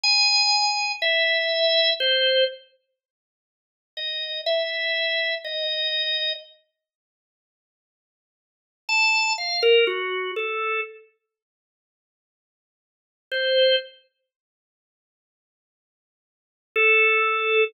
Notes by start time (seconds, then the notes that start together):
0.03 G#5
1.02 E5
2.00 C5
3.97 D#5
4.46 E5
5.44 D#5
8.89 A5
9.38 F5
9.63 A#4
9.87 F#4
10.36 A4
13.32 C5
16.76 A4